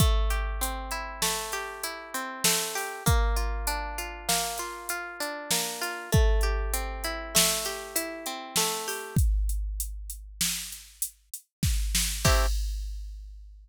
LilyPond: <<
  \new Staff \with { instrumentName = "Pizzicato Strings" } { \time 5/4 \key a \phrygian \tempo 4 = 98 a8 g'8 c'8 e'8 a8 g'8 e'8 c'8 a8 g'8 | bes8 f'8 d'8 f'8 bes8 f'8 f'8 d'8 bes8 f'8 | a8 g'8 c'8 e'8 a8 g'8 e'8 c'8 a8 g'8 | r1 r4 |
<a c' e' g'>4 r1 | }
  \new DrumStaff \with { instrumentName = "Drums" } \drummode { \time 5/4 <hh bd>8 hh8 hh8 hh8 sn8 hh8 hh8 hh8 sn8 hho8 | <hh bd>8 hh8 hh8 hh8 sn8 hh8 hh8 hh8 sn8 hh8 | <hh bd>8 hh8 hh8 hh8 sn8 hh8 hh8 hh8 sn8 hho8 | <hh bd>8 hh8 hh8 hh8 sn8 hh8 hh8 hh8 <bd sn>8 sn8 |
<cymc bd>4 r4 r4 r4 r4 | }
>>